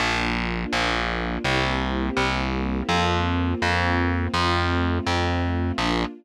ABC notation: X:1
M:4/4
L:1/8
Q:1/4=83
K:Bb
V:1 name="String Ensemble 1"
[B,DF]4 [B,C=EG]4 | [B,CF]4 [A,CF]4 | [B,DF]2 z6 |]
V:2 name="Electric Bass (finger)" clef=bass
B,,,2 B,,,2 C,,2 C,,2 | F,,2 F,,2 F,,2 F,,2 | B,,,2 z6 |]